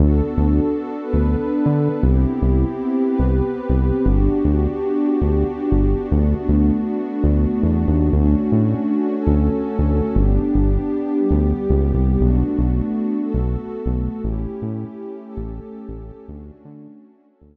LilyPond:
<<
  \new Staff \with { instrumentName = "Pad 2 (warm)" } { \time 4/4 \key d \major \tempo 4 = 118 <b d' fis' a'>2 <b d' a' b'>2 | <b c' e' g'>2 <b c' g' b'>2 | <b d' fis' g'>1 | <a b d' fis'>1 |
<a cis' d' fis'>2 <a cis' fis' a'>2 | <b d' g'>2 <g b g'>2 | <a b d' fis'>2 <a b fis' a'>2 | <a cis' e' g'>2 <a cis' g' a'>2 |
<a cis' d' fis'>2 <a cis' fis' a'>2 | }
  \new Staff \with { instrumentName = "Synth Bass 1" } { \clef bass \time 4/4 \key d \major d,8. d,4. d,4 d8. | c,8. c,4. c,4 c,8. | g,,8. d,4. d,4 g,,8. | d,8. d,4. d,8. e,8 dis,8 |
d,8. a,4. d,4 d,8. | g,,8. g,,4. d,8. cis,8 c,8 | b,,8. b,,4. b,,4 b,,8. | a,,8. a,4. a,,4 a,,8. |
d,8. d4. d,4 r8. | }
>>